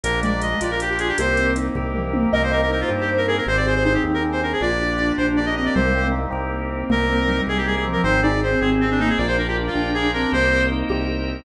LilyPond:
<<
  \new Staff \with { instrumentName = "Clarinet" } { \time 6/8 \key c \minor \tempo 4. = 105 bes'8 d''8 ees''8 d''16 bes'16 g'16 g'16 aes'16 g'16 | c''4 r2 | bes'16 c''16 bes'16 bes'16 bes'16 f'16 r16 g'16 r16 bes'16 aes'16 bes'16 | c''16 d''16 c''16 c''16 c''16 g'16 r16 bes'16 r16 c''16 bes'16 aes'16 |
d''4. c''16 r16 d''16 ees''16 ees''16 d''16 | c''4 r2 | bes'4. aes'16 g'16 aes'16 aes'16 r16 bes'16 | c''8 d''8 c''8 aes'16 r16 c'16 d'16 ees'16 aes'16 |
d''16 c''16 bes'16 g'16 r16 f'8. aes'8 bes'8 | c''4 r2 | }
  \new Staff \with { instrumentName = "Ocarina" } { \time 6/8 \key c \minor r8 aes4 f'4. | <g' bes'>4 r2 | ees''8 ees''8 c''4. bes'8 | g'8 g'8 ees'4. d'8 |
f'8 f'8 d'4. c'8 | g8 aes16 c'16 g8 r4. | bes8 bes8 g4. f8 | ees'8 ees'8 c'4. bes8 |
f'8 f'8 d'4. c'8 | g'8 r4 g'8 r4 | }
  \new Staff \with { instrumentName = "Acoustic Grand Piano" } { \time 6/8 \key c \minor bes8 d'8 f'8 g'8 bes8 d'8 | bes8 c'8 ees'8 g'8 bes8 c'8 | bes8 c'8 ees'8 g'8 bes8 c'8 | c'8 aes'8 c'8 g'8 c'8 aes'8 |
bes8 d'8 f'8 g'8 bes8 d'8 | bes8 c'8 ees'8 g'8 bes8 c'8 | bes8 c'8 ees'8 g'8 bes8 c'8 | c'8 aes'8 c'8 g'8 c'8 aes'8 |
bes8 d'8 f'8 g'8 bes8 d'8 | bes8 c'8 ees'8 g'8 bes8 c'8 | }
  \new Staff \with { instrumentName = "Synth Bass 1" } { \clef bass \time 6/8 \key c \minor bes,,4. bes,,4. | c,4. c,4. | c,4. g,4. | aes,,4. ees,4. |
bes,,4. bes,,4. | c,4. c,4. | c,4. c,4. | aes,,4. aes,,4. |
bes,,4. bes,,4. | c,4. c,4. | }
  \new Staff \with { instrumentName = "Drawbar Organ" } { \time 6/8 \key c \minor <bes d' f' g'>4. <bes d' g' bes'>4. | <bes c' ees' g'>4. <bes c' g' bes'>4. | <bes c' ees' g'>4. <bes c' g' bes'>4. | r2. |
<bes d' f' g'>4. <bes d' g' bes'>4. | <bes c' ees' g'>4. <bes c' g' bes'>4. | <bes c' ees' g'>4. <bes c' g' bes'>4. | <c' ees' g' aes'>4. <c' ees' aes' c''>4. |
<bes' d'' f'' g''>4. <bes' d'' g'' bes''>4. | <bes' c'' ees'' g''>4. <bes' c'' g'' bes''>4. | }
  \new DrumStaff \with { instrumentName = "Drums" } \drummode { \time 6/8 hh8 hh8 hh8 hh8 hh8 hh8 | hh8 hh8 hh8 <bd tomfh>8 toml8 tommh8 | r4. r4. | r4. r4. |
r4. r4. | r4. r4. | r4. r4. | r4. r4. |
r4. r4. | r4. r4. | }
>>